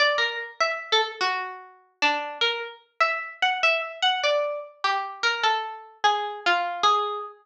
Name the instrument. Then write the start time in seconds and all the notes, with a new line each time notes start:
harpsichord
0.00 D5
0.18 A#4
0.60 E5
0.92 A4
1.21 F#4
2.02 D4
2.41 A#4
3.01 E5
3.42 F#5
3.63 E5
4.02 F#5
4.23 D5
4.84 G4
5.23 A#4
5.43 A4
6.04 G#4
6.46 F4
6.83 G#4